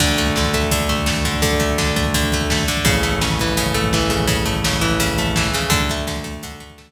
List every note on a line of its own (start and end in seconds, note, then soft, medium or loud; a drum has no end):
0.00 2.63 D2 loud
0.00 0.37 D3 loud
0.00 kick loud
0.00 crash loud
0.09 kick medium
0.18 0.54 A3 medium
0.18 kick medium
0.18 closed hi-hat medium
0.27 kick loud
0.36 0.71 D3 medium
0.36 kick loud
0.36 snare loud
0.45 kick loud
0.53 0.89 A3 medium
0.53 kick loud
0.53 closed hi-hat medium
0.63 kick medium
0.71 1.25 D3 medium
0.71 kick loud
0.71 closed hi-hat loud
0.80 kick medium
0.89 1.06 A3 medium
0.89 kick medium
0.89 closed hi-hat medium
0.98 kick medium
1.06 1.59 A3 medium
1.06 kick loud
1.06 snare loud
1.16 kick medium
1.25 1.42 D3 medium
1.25 kick loud
1.25 closed hi-hat medium
1.34 kick medium
1.42 1.78 D3 medium
1.42 kick loud
1.42 closed hi-hat loud
1.52 kick loud
1.60 1.96 A3 medium
1.60 kick medium
1.60 closed hi-hat medium
1.70 kick medium
1.78 2.14 D3 medium
1.78 kick loud
1.78 snare loud
1.88 kick medium
1.96 2.33 A3 medium
1.96 kick loud
1.96 closed hi-hat medium
2.05 kick loud
2.14 2.68 D3 medium
2.14 kick loud
2.14 closed hi-hat loud
2.23 kick loud
2.32 2.51 A3 medium
2.32 kick loud
2.32 closed hi-hat medium
2.41 kick medium
2.50 2.85 A3 medium
2.50 kick loud
2.50 snare loud
2.59 kick loud
2.68 2.85 D3 medium
2.68 kick medium
2.68 closed hi-hat loud
2.77 kick loud
2.85 5.49 A1 medium
2.85 3.21 C#3 loud
2.85 kick loud
2.85 closed hi-hat loud
2.95 kick medium
3.03 3.74 A3 medium
3.03 kick medium
3.03 closed hi-hat medium
3.12 kick medium
3.21 3.57 C#3 medium
3.21 kick loud
3.21 snare loud
3.30 kick loud
3.39 3.93 E3 medium
3.39 kick medium
3.39 closed hi-hat medium
3.48 kick medium
3.57 4.09 C#3 medium
3.57 kick medium
3.57 closed hi-hat loud
3.66 kick loud
3.74 4.45 A3 medium
3.74 kick medium
3.74 closed hi-hat medium
3.84 kick loud
3.93 4.81 E3 medium
3.93 kick loud
3.93 snare loud
4.02 kick medium
4.10 4.27 C#3 medium
4.10 kick loud
4.10 closed hi-hat medium
4.20 kick loud
4.27 4.64 C#3 medium
4.27 kick loud
4.27 closed hi-hat loud
4.38 kick medium
4.46 5.18 A3 medium
4.46 kick loud
4.46 closed hi-hat medium
4.55 kick medium
4.64 4.99 C#3 medium
4.64 kick medium
4.64 snare loud
4.73 kick loud
4.81 5.37 E3 medium
4.81 kick medium
4.81 closed hi-hat medium
4.91 kick medium
5.00 5.54 C#3 medium
5.00 kick loud
5.00 closed hi-hat loud
5.09 kick loud
5.18 5.69 A3 medium
5.18 kick medium
5.18 closed hi-hat medium
5.27 kick medium
5.36 5.71 E3 medium
5.36 kick loud
5.36 snare loud
5.45 kick medium
5.54 5.71 C#3 medium
5.54 kick medium
5.54 closed hi-hat medium
5.62 kick medium
5.70 6.92 D2 medium
5.70 6.07 D3 loud
5.70 kick loud
5.70 closed hi-hat loud
5.80 kick loud
5.89 6.24 A3 medium
5.89 kick loud
5.89 closed hi-hat medium
5.98 kick medium
6.07 6.43 D3 medium
6.07 kick loud
6.07 snare loud
6.16 kick loud
6.24 6.60 A3 medium
6.24 kick loud
6.24 closed hi-hat medium
6.34 kick medium
6.43 6.92 D3 medium
6.43 kick loud
6.43 closed hi-hat loud
6.52 kick medium
6.60 6.77 A3 medium
6.60 kick medium
6.60 closed hi-hat medium
6.70 kick loud
6.78 6.92 A3 medium
6.78 kick loud
6.78 snare loud
6.87 kick medium